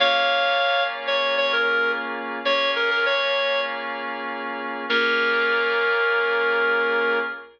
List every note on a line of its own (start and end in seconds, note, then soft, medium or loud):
0.00 2.40 A#3 medium
0.00 2.40 C#4 medium
0.00 2.40 F4 medium
0.00 2.40 G#4 medium
0.00 0.83 C#5 loud
0.00 0.83 F5 loud
1.07 1.35 C#5 loud
1.38 1.52 C#5 loud
1.53 1.91 A#4 loud
2.45 4.85 A#3 medium
2.45 4.85 C#4 medium
2.45 4.85 F4 medium
2.45 4.85 G#4 medium
2.45 2.71 C#5 loud
2.76 2.90 A#4 loud
2.91 3.05 A#4 loud
3.06 3.61 C#5 loud
4.89 7.19 A#3 loud
4.89 7.19 C#4 loud
4.89 7.19 F4 loud
4.89 7.19 G#4 loud
4.89 7.19 A#4 loud